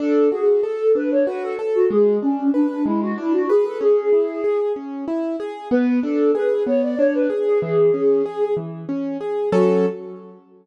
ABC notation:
X:1
M:6/8
L:1/16
Q:3/8=63
K:F#m
V:1 name="Flute"
A2 G2 A2 B c B A z F | G2 C2 D2 E F E F G A | G6 z6 | B2 A2 B2 c d c B z G |
G6 z6 | F6 z6 |]
V:2 name="Acoustic Grand Piano"
D2 F2 A2 D2 F2 A2 | G,2 D2 B2 G,2 D2 B2 | C2 E2 G2 C2 E2 G2 | B,2 D2 G2 B,2 D2 G2 |
E,2 C2 G2 E,2 C2 G2 | [F,CA]6 z6 |]